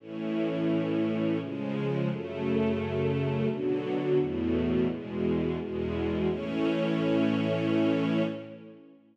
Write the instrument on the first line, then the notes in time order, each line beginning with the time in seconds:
string ensemble 1
0.00 A2 E3 C#4
1.40 C#3 F3 G#3
2.09 F#2 C#3 A3
3.49 B2 D3 F#3
4.17 E2 A2 B2
4.88 E2 B2 G#3
5.59 E2 B2 G#3
6.28 A2 E3 C#4